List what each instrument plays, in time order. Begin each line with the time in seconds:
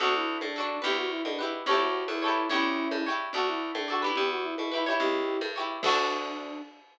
0.00 electric bass (finger) D2, pizzicato strings D4 F#4 A4, flute F#4, low conga
0.15 flute E4
0.41 electric bass (finger) A2, flute D4, high conga
0.56 pizzicato strings D4 F#4 A4
0.82 electric bass (finger) D2, pizzicato strings E4 G4 B4, flute G4, low conga
0.97 flute F#4
1.10 flute E4
1.24 electric bass (finger) B2, flute D4, high conga
1.39 flute E4, pizzicato strings E4 G4 B4
1.66 electric bass (finger) D2, flute G4, pizzicato strings A4 C#5, low conga
1.71 pizzicato strings E4 G4
1.80 flute F#4
2.08 electric bass (finger) E2, flute E4, high conga
2.22 pizzicato strings G4 A4 C#5
2.28 pizzicato strings E4
2.50 electric bass (finger) D2, flute C#4 E4, pizzicato strings G4 C#5, low conga
2.54 pizzicato strings E4
2.91 electric bass (finger) G2, high conga
3.06 pizzicato strings E4 G4 C#5
3.33 electric bass (finger) D2, flute F#4, pizzicato strings A4 D5, low conga
3.37 pizzicato strings F#4
3.48 flute E4
3.75 electric bass (finger) A2, flute D4, high conga
3.88 pizzicato strings F#4 A4 D5
4.02 pizzicato strings E4 G4 B4
4.16 electric bass (finger) E2, flute G4, low conga
4.31 flute F#4
4.43 flute E4
4.58 electric bass (finger) B2, flute E4, high conga
4.72 flute E4, pizzicato strings E4 G4 B4
4.86 pizzicato strings E4 G4 C#5
5.00 electric bass (finger) C#2, flute E4 G4, low conga
5.41 electric bass (finger) G2, high conga
5.56 pizzicato strings E4 G4 C#5
5.83 electric bass (finger) D2, flute D4, pizzicato strings F#4 A4, kick, crash
5.88 pizzicato strings D4